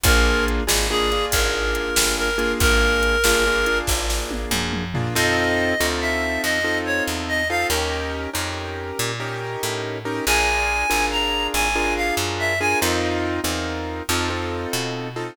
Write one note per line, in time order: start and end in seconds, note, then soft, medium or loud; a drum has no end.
0.04 0.61 A#1 loud
0.04 0.63 A#3 loud
0.04 0.63 D4 loud
0.04 0.63 F4 loud
0.04 0.63 G#4 loud
0.04 0.45 A#4 loud
0.04 kick loud
0.04 closed hi-hat loud
0.48 closed hi-hat medium
0.67 1.26 G#1 medium
0.67 0.87 A#3 medium
0.67 0.87 D4 medium
0.67 0.87 F4 medium
0.67 0.87 G#4 medium
0.67 snare loud
0.90 1.10 A#3 medium
0.90 1.10 D4 loud
0.90 1.10 F4 medium
0.90 1.25 G#4 loud
0.90 1.10 G#4 medium
1.12 2.29 A#3 medium
1.12 2.29 D4 loud
1.12 2.29 F4 medium
1.12 2.29 G#4 medium
1.12 closed hi-hat medium
1.32 1.91 G#1 medium
1.32 2.15 A#4 medium
1.32 kick loud
1.32 closed hi-hat loud
1.75 closed hi-hat medium
1.96 2.55 G1 medium
1.96 snare loud
2.18 2.52 A#4 loud
2.38 3.16 A#3 loud
2.38 3.16 D4 medium
2.38 3.16 F4 medium
2.38 3.16 G#4 loud
2.38 closed hi-hat medium
2.60 3.18 G#1 medium
2.60 3.78 A#4 loud
2.60 kick loud
2.60 closed hi-hat loud
3.03 closed hi-hat medium
3.24 3.82 G1 medium
3.24 3.44 A#3 loud
3.24 3.44 D4 medium
3.24 3.44 F4 loud
3.24 3.44 G#4 medium
3.24 snare loud
3.47 3.66 A#3 medium
3.47 3.66 D4 loud
3.47 3.66 F4 loud
3.47 3.66 G#4 medium
3.66 4.84 A#3 loud
3.66 4.84 D4 medium
3.66 4.84 F4 medium
3.66 4.84 G#4 medium
3.66 closed hi-hat medium
3.87 4.46 G#1 medium
3.87 kick loud
3.87 snare medium
4.10 snare loud
4.31 high tom medium
4.51 5.09 F#2 medium
4.51 mid tom loud
4.73 mid tom loud
4.94 5.14 A#3 medium
4.94 5.14 D4 medium
4.94 5.14 F4 medium
4.94 5.14 G#4 medium
4.94 floor tom loud
5.15 5.74 F2 medium
5.15 5.74 C4 loud
5.15 5.74 D#4 medium
5.15 5.74 F4 loud
5.15 5.74 A4 loud
5.15 5.86 D#5 loud
5.80 6.38 D2 medium
5.80 6.59 C4 medium
5.80 6.59 D#4 medium
5.80 6.59 F4 medium
5.80 6.59 A4 medium
6.01 6.42 E5 medium
6.43 7.01 F2 medium
6.43 6.78 D#5 loud
6.64 7.43 C4 medium
6.64 7.43 D#4 medium
6.64 7.43 F4 loud
6.64 7.43 A4 medium
6.86 7.04 C#5 loud
7.07 7.65 E2 medium
7.28 7.48 D#5 loud
7.50 7.69 C4 medium
7.50 7.69 D#4 loud
7.50 7.69 F4 loud
7.50 7.69 A4 medium
7.50 7.67 F5 loud
7.70 8.27 D#2 medium
7.70 8.30 C#4 loud
7.70 8.30 D#4 medium
7.70 8.30 G4 loud
7.70 8.30 A#4 loud
8.34 8.92 F2 medium
8.34 9.12 C#4 medium
8.34 9.12 D#4 medium
8.34 9.12 G4 medium
8.34 9.12 A#4 medium
8.99 9.57 A#2 medium
9.20 9.98 C#4 medium
9.20 9.98 D#4 medium
9.20 9.98 G4 medium
9.20 9.98 A#4 medium
9.63 10.20 A2 medium
10.05 10.25 C#4 medium
10.05 10.25 D#4 medium
10.05 10.25 G4 medium
10.05 10.25 A#4 medium
10.26 10.84 A#1 medium
10.26 10.86 D4 medium
10.26 10.86 F4 loud
10.26 10.86 G#4 loud
10.26 10.86 A#4 loud
10.26 11.06 G#5 loud
10.90 11.48 G#1 medium
10.90 11.68 D4 medium
10.90 11.68 F4 medium
10.90 11.68 G#4 medium
10.90 11.68 A#4 medium
11.11 11.47 A#5 medium
11.54 12.12 G#1 medium
11.54 11.94 G#5 loud
11.75 12.54 D4 medium
11.75 12.54 F4 loud
11.75 12.54 G#4 medium
11.75 12.54 A#4 medium
11.96 12.15 F5 medium
12.17 12.75 F#2 medium
12.39 12.59 E5 loud
12.60 12.80 D4 medium
12.60 12.80 F4 medium
12.60 12.80 G#4 loud
12.60 12.80 A#4 medium
12.60 12.79 G#5 loud
12.82 13.40 F2 medium
12.82 13.40 C4 loud
12.82 13.40 D#4 loud
12.82 13.40 F4 loud
12.82 13.40 A#4 loud
13.44 14.02 E2 medium
13.44 14.02 C4 medium
13.44 14.02 D#4 medium
13.44 14.02 F4 medium
13.44 14.02 A#4 medium
14.09 14.66 F2 medium
14.09 14.29 C4 loud
14.09 14.29 D#4 loud
14.09 14.29 F4 loud
14.09 14.29 A4 loud
14.30 15.08 C4 medium
14.30 15.08 D#4 medium
14.30 15.08 F4 medium
14.30 15.08 A4 medium
14.73 15.31 B2 medium
15.16 15.36 C4 medium
15.16 15.36 D#4 medium
15.16 15.36 F4 medium
15.16 15.36 A4 medium